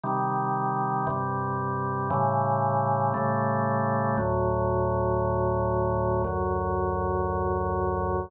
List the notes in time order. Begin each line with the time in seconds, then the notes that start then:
0.03 C3 D#3 G3
1.07 G2 C3 G3
2.10 A2 C#3 E3 G3
3.14 A2 C#3 G3 A3
4.17 D2 A2 F#3
6.24 D2 F#2 F#3